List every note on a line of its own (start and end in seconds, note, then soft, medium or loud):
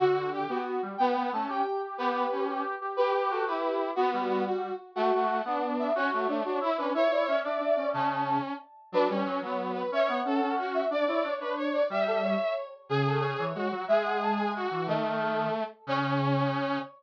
0.00 0.45 D3 medium
0.00 0.30 F#4 loud
0.00 0.30 F#4 medium
0.32 0.46 G4 medium
0.32 0.62 G4 medium
0.49 0.77 B3 medium
0.49 0.82 F#4 medium
0.83 0.97 G3 medium
0.98 1.30 B3 medium
0.98 1.15 B3 medium
0.98 1.25 G5 loud
1.16 1.31 B3 medium
1.32 1.46 A3 medium
1.32 1.62 C#4 medium
1.32 1.49 A5 medium
1.49 1.96 G4 medium
1.49 1.80 G5 medium
1.98 2.26 B3 medium
1.98 2.45 G4 medium
1.98 2.42 B4 loud
2.31 2.63 C#4 medium
2.48 2.75 G4 medium
2.81 2.97 G4 medium
2.97 3.43 G4 medium
2.97 3.13 G4 medium
2.97 3.28 B4 loud
3.14 3.27 G4 medium
3.30 3.46 F#4 medium
3.30 3.45 A4 medium
3.46 3.91 E4 medium
3.46 3.88 G4 medium
3.46 3.77 B4 medium
3.96 4.11 B3 medium
3.96 4.45 B3 medium
3.96 4.10 F#4 medium
4.12 4.69 G3 medium
4.12 4.28 F#4 medium
4.28 4.42 F#4 medium
4.47 4.74 F#4 medium
4.95 5.12 A3 medium
4.95 5.37 F#4 medium
4.95 5.64 F#5 loud
5.13 5.41 A3 medium
5.45 5.90 B3 medium
5.45 5.93 D4 medium
5.79 5.93 E5 medium
5.95 6.10 C#4 medium
5.95 6.10 F#4 loud
5.95 6.71 C#5 loud
6.11 6.27 A3 medium
6.11 6.27 F#4 medium
6.27 6.43 A3 medium
6.27 6.41 D4 medium
6.44 6.59 D4 medium
6.44 6.59 F#4 medium
6.61 6.76 E4 medium
6.78 6.93 C#4 medium
6.78 6.93 D4 medium
6.78 6.91 B4 loud
6.94 7.08 E4 medium
6.94 7.39 C#5 medium
6.94 7.11 E5 medium
7.11 7.25 E4 medium
7.11 7.26 D5 medium
7.26 7.42 C#4 medium
7.26 7.74 E5 loud
7.43 7.58 D4 medium
7.43 7.87 D5 medium
7.60 7.76 D4 medium
7.75 7.93 C#4 medium
7.75 7.89 D5 medium
7.93 8.38 C#3 loud
7.93 8.53 C#4 medium
7.93 8.38 A5 loud
8.92 9.08 F#3 medium
8.92 9.08 D4 medium
8.92 9.10 B4 loud
9.08 9.23 G3 medium
9.08 9.40 C#4 medium
9.08 9.69 C#5 medium
9.26 9.41 F#3 medium
9.42 9.84 F#3 medium
9.42 9.82 B3 medium
9.74 9.90 B4 medium
9.92 10.08 C#4 medium
9.92 10.20 C#5 medium
9.92 10.09 E5 loud
10.08 10.21 B3 medium
10.08 10.67 F#5 loud
10.25 10.40 C#4 medium
10.25 10.55 A4 medium
10.41 10.81 C#4 medium
10.58 10.85 F#4 medium
10.74 10.88 E5 loud
10.91 11.04 D4 loud
10.91 11.32 D5 medium
10.91 11.05 D5 loud
11.08 11.23 E4 medium
11.08 11.70 C#5 medium
11.24 11.39 D4 medium
11.41 11.82 D4 medium
11.41 11.54 B4 medium
11.56 11.83 C#5 medium
11.74 11.89 D5 loud
11.90 12.35 G3 medium
11.90 12.05 G4 medium
11.90 12.54 E5 medium
12.07 12.21 A4 loud
12.23 12.67 C#5 medium
12.89 13.34 C#3 loud
12.89 13.44 G#4 medium
12.89 13.06 G#4 loud
13.06 13.21 A4 loud
13.21 13.35 C#5 loud
13.39 13.53 E3 medium
13.39 13.68 C#5 loud
13.55 13.69 G#3 medium
13.55 13.85 F#4 medium
13.72 13.85 F#3 medium
13.88 14.65 G#3 medium
13.88 14.50 G#4 medium
13.88 14.03 E5 loud
14.05 14.19 F#5 medium
14.22 14.37 A5 medium
14.38 14.65 G#5 loud
14.56 14.86 F#4 medium
14.71 14.87 E3 medium
14.86 15.48 D#3 loud
14.86 15.64 A3 medium
14.86 15.19 D#5 loud
15.22 15.54 A4 medium
15.87 16.79 C#3 loud
15.87 16.79 C#4 loud
15.87 16.80 C#5 loud